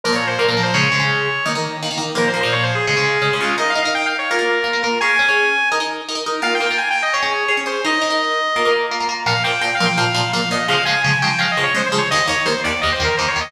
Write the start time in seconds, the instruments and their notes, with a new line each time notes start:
0.04 overdriven guitar A#2 F3 A#3, lead 2 (sawtooth) A#4
0.12 overdriven guitar A#2 F3 A#3, lead 2 (sawtooth) C#5
0.27 lead 2 (sawtooth) C5
0.38 overdriven guitar A#2 F3 A#3, lead 2 (sawtooth) A#4
0.48 overdriven guitar A#2 F3 A#3, lead 2 (sawtooth) A#4
0.57 overdriven guitar A#2 F3 A#3
0.63 lead 2 (sawtooth) C5
0.74 overdriven guitar C#3 G#3 C#4, lead 2 (sawtooth) C#5
0.92 overdriven guitar C#3 G#3 C#4
1.00 overdriven guitar C#3 G#3 C#4
1.46 overdriven guitar D#3 A#3 D#4
1.55 overdriven guitar D#3 A#3 D#4
1.82 overdriven guitar D#3 A#3 D#4
1.91 overdriven guitar D#3 A#3 D#4
1.98 overdriven guitar D#3 A#3 D#4
2.15 overdriven guitar A#2 F3 A#3, lead 2 (sawtooth) A#4
2.28 lead 2 (sawtooth) C5
2.34 overdriven guitar A#2 F3 A#3
2.41 overdriven guitar A#2 F3 A#3, lead 2 (sawtooth) C5
2.53 lead 2 (sawtooth) C#5
2.63 lead 2 (sawtooth) C5
2.75 lead 2 (sawtooth) G#4
2.87 overdriven guitar C#3 G#3 C#4, lead 2 (sawtooth) G#4
2.97 overdriven guitar C#3 G#3 C#4
3.22 overdriven guitar C#3 G#3 C#4
3.33 overdriven guitar C#3 G#3 C#4
3.40 overdriven guitar C#3 G#3 C#4, lead 2 (sawtooth) F4
3.58 overdriven guitar D#4 A#4 D#5, lead 2 (sawtooth) D#5
3.70 lead 2 (sawtooth) F5
3.75 overdriven guitar D#4 A#4 D#5
3.83 overdriven guitar D#4 A#4 D#5, lead 2 (sawtooth) F5
3.95 lead 2 (sawtooth) G5
4.06 lead 2 (sawtooth) F5
4.19 lead 2 (sawtooth) C#5
4.31 overdriven guitar A#3 F4 A#4, lead 2 (sawtooth) A#4
4.39 overdriven guitar A#3 F4 A#4
4.64 overdriven guitar A#3 F4 A#4
4.73 overdriven guitar A#3 F4 A#4
4.83 overdriven guitar A#3 F4 A#4, lead 2 (sawtooth) A#4
5.01 overdriven guitar C#4 G#4 C#5, lead 2 (sawtooth) G#5
5.19 overdriven guitar C#4 G#4 C#5
5.29 overdriven guitar C#4 G#4 C#5
5.72 overdriven guitar D#4 A#4 D#5
5.80 overdriven guitar D#4 A#4 D#5
6.09 overdriven guitar D#4 A#4 D#5
6.15 overdriven guitar D#4 A#4 D#5
6.26 overdriven guitar D#4 A#4 D#5
6.42 overdriven guitar A#3 F4 A#4, lead 2 (sawtooth) F5
6.55 lead 2 (sawtooth) G5
6.60 overdriven guitar A#3 F4 A#4
6.66 lead 2 (sawtooth) G5
6.71 overdriven guitar A#3 F4 A#4
6.78 lead 2 (sawtooth) G#5
6.90 lead 2 (sawtooth) G5
7.03 lead 2 (sawtooth) D#5
7.13 overdriven guitar C#4 G#4 C#5, lead 2 (sawtooth) C#5
7.23 overdriven guitar C#4 G#4 C#5
7.48 overdriven guitar C#4 G#4 C#5
7.57 overdriven guitar C#4 G#4 C#5
7.66 overdriven guitar C#4 G#4 C#5, lead 2 (sawtooth) C5
7.85 overdriven guitar D#4 A#4 D#5, lead 2 (sawtooth) D#5
8.02 overdriven guitar D#4 A#4 D#5
8.10 overdriven guitar D#4 A#4 D#5
8.56 overdriven guitar A#3 F4 A#4
8.65 overdriven guitar A#3 F4 A#4
8.91 overdriven guitar A#3 F4 A#4
9.00 overdriven guitar A#3 F4 A#4
9.09 overdriven guitar A#3 F4 A#4
9.26 overdriven guitar A#2 F3 A#3, lead 2 (sawtooth) F5
9.44 overdriven guitar A#2 F3 A#3, lead 2 (sawtooth) G5
9.61 overdriven guitar A#2 F3 A#3, lead 2 (sawtooth) G5
9.75 lead 2 (sawtooth) F5
9.80 overdriven guitar A#2 F3 A#3
9.85 lead 2 (sawtooth) G5
9.97 overdriven guitar A#2 F3 A#3, lead 2 (sawtooth) F5
10.14 overdriven guitar A#2 F3 A#3
10.33 overdriven guitar A#2 F3 A#3, lead 2 (sawtooth) F5
10.51 overdriven guitar A#2 F3 A#3, lead 2 (sawtooth) D#5
10.68 overdriven guitar C#3 F3 G#3, lead 2 (sawtooth) F5
10.85 overdriven guitar C#3 F3 G#3, lead 2 (sawtooth) G#5
11.04 overdriven guitar C#3 F3 G#3, lead 2 (sawtooth) G#5
11.22 overdriven guitar C#3 F3 G#3, lead 2 (sawtooth) G5
11.39 overdriven guitar C#3 F3 G#3, lead 2 (sawtooth) F5
11.51 lead 2 (sawtooth) D#5
11.57 overdriven guitar C#3 F3 G#3
11.63 lead 2 (sawtooth) C#5
11.74 overdriven guitar C#3 F3 G#3, lead 2 (sawtooth) C5
11.86 lead 2 (sawtooth) C5
11.92 overdriven guitar C#3 F3 G#3
11.98 lead 2 (sawtooth) C#5
12.11 overdriven guitar D#2 D#3 A#3, lead 2 (sawtooth) D#5
12.27 overdriven guitar D#2 D#3 A#3, lead 2 (sawtooth) C#5
12.46 overdriven guitar D#2 D#3 A#3, lead 2 (sawtooth) C5
12.64 overdriven guitar D#2 D#3 A#3, lead 2 (sawtooth) D5
12.81 overdriven guitar D#2 D#3 A#3, lead 2 (sawtooth) D#5
12.92 lead 2 (sawtooth) C5
13.00 overdriven guitar D#2 D#3 A#3
13.05 lead 2 (sawtooth) A#4
13.17 overdriven guitar D#2 D#3 A#3, lead 2 (sawtooth) C5
13.28 lead 2 (sawtooth) C#5
13.36 overdriven guitar D#2 D#3 A#3
13.41 lead 2 (sawtooth) D#5